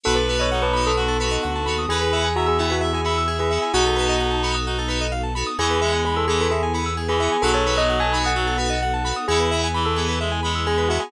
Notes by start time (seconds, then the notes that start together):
0.03 B1 B3 D#4 F#4 A4 B4
0.15 A4 B4
0.29 B3 D#4 F#4 A4 B4
0.39 C#5 D#5
0.52 D#4 F#5
0.62 B4 A5
0.73 B3 D#4 F#4 A4 B5
0.86 A4 D#6
0.97 F#4
1.08 A4
1.20 B3 D#4 F#4 A4 B4
1.31 D#5
1.43 D2 F#5
1.55 A5
1.66 D#2 B3 D#4 F#4 A4 B5
1.78 D#6
1.88 E2 B3 E4 G#4 B4
2.01 B4
2.12 B3 E4 G#4 E5
2.24 G#5
2.36 F#4 E5 A#5
2.46 G#4 E6
2.58 B3 E4 G#4
2.70 F#4 B4
2.81 E5
2.93 G#4 G#5
3.04 B3 E4 G#4 E5 B5
3.18 E6
3.28 G#4
3.39 G#4 B4
3.50 B3 E4 G#4 E5
3.62 G#5
3.73 B1 B3 D#4 F#4 A4
3.86 A4
3.96 B3 D#4 F#4 A4 B4
4.09 D#5
4.20 F#5
4.31 A5
4.42 B3 D#4 F#4 A4 B5
4.55 D#6
4.66 D#4 F#4
4.78 A4
4.88 B3 D#4 F#4 A4 B4
5.01 D#5
5.12 F5
5.23 A5
5.35 B3 D#4 F#4 A4 B5
5.47 D#6
5.58 E2 E3 B3 E4 G#4
5.70 B4
5.81 G#3 B3 E4 G#4 E5
5.93 G#5
6.05 G#4 B5
6.16 A4 E6
6.28 E3 B3 E4 G#4
6.40 A4 B4
6.51 G#4 E5
6.63 G#5
6.73 B3 E4 G#4 B5
6.86 E6
6.97 G#4
7.08 E3 G#4 B4
7.20 B3 E4 G#4 E5
7.32 G#5
7.42 B1 F#3 B3 D#4 F#4 A4
7.54 A4 C#5
7.66 B3 D#4 F#4 A4 B4
7.78 D#5
7.89 F#5
8.00 G#5 A5
8.13 B3 D#4 F#4 A4 B5
8.24 F#5 D#6
8.35 F#3 F#4
8.47 A4
8.58 B3 D#4 F#4 A4 B4
8.70 D#5
8.82 F#5
8.94 A5
9.05 B3 D#4 F#4 A4 B5
9.16 D#6
9.28 E2 B3 E4 G#4
9.40 B4
9.51 B3 E4 G#4 E5
9.64 G#5
9.74 E3 B5
9.85 A4 E6
9.96 B3 E4 G#4
10.08 B4
10.20 G#3 E5
10.32 G#5
10.43 G#3 B3 E4 G#4 B5
10.55 E6
10.67 G#4
10.78 B4
10.89 B3 E4 F#4 G#4 E5
11.00 G#4 G#5